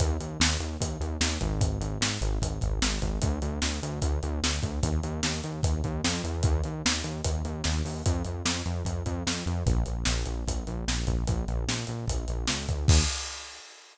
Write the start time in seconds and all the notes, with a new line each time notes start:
0.00 D#2, kick, closed hi-hat
0.20 D#2, closed hi-hat
0.40 D#2, snare
0.60 D#2, closed hi-hat
0.80 D#2, kick, closed hi-hat
1.00 D#2, closed hi-hat
1.21 D#2, snare
1.41 G#1, kick, closed hi-hat
1.61 kick, closed hi-hat
1.81 G#1, closed hi-hat
2.01 G#1, snare
2.21 G#1, closed hi-hat
2.41 G#1, kick, closed hi-hat
2.61 G#1, kick, closed hi-hat
2.82 G#1, snare
3.02 G#1, kick, closed hi-hat
3.22 D2, kick, closed hi-hat
3.42 D2, closed hi-hat
3.62 D2, snare
3.83 D2, closed hi-hat
4.02 D2, kick, closed hi-hat
4.23 D2, closed hi-hat
4.43 D2, snare
4.63 D2, kick, closed hi-hat
4.83 D#2, kick, closed hi-hat
5.03 D#2, closed hi-hat
5.23 D#2, snare
5.44 D#2, closed hi-hat
5.63 D#2, kick, closed hi-hat
5.84 D#2, kick, closed hi-hat
6.04 F2, snare
6.24 E2, closed hi-hat
6.43 D#2, kick, closed hi-hat
6.64 D#2, closed hi-hat
6.85 D#2, snare
7.04 D#2, closed hi-hat
7.24 D#2, kick, closed hi-hat
7.45 D#2, closed hi-hat
7.64 D#2, snare
7.85 D#2, open hi-hat
8.06 F2, kick, closed hi-hat
8.25 F2, closed hi-hat
8.45 F2, snare
8.66 F2, closed hi-hat
8.85 F2, kick, closed hi-hat
9.06 F2, kick, closed hi-hat
9.27 F2, snare
9.46 F2, closed hi-hat
9.66 A#1, kick, closed hi-hat
9.86 A#1, closed hi-hat
10.05 A#1, snare
10.26 A#1, closed hi-hat
10.47 A#1, kick, closed hi-hat
10.67 A#1, closed hi-hat
10.88 A#1, snare
11.07 A#1, kick, closed hi-hat
11.27 A#1, kick, closed hi-hat
11.48 A#1, closed hi-hat
11.68 A#1, snare
11.87 A#1, closed hi-hat
12.08 A#1, kick, closed hi-hat
12.28 A#1, closed hi-hat
12.47 C#2, snare
12.68 D2, kick, closed hi-hat
12.88 D#2, kick, crash